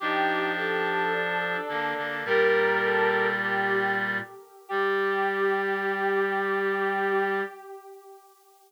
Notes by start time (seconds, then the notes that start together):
0.00 F3 D4 D#4 G4
0.55 G4 A4
1.13 D4
1.68 D3 A#3 D4
1.97 D3 A#3
2.25 A#2 G3 G4 A#4
2.84 A4
3.44 G4
4.69 G3 G4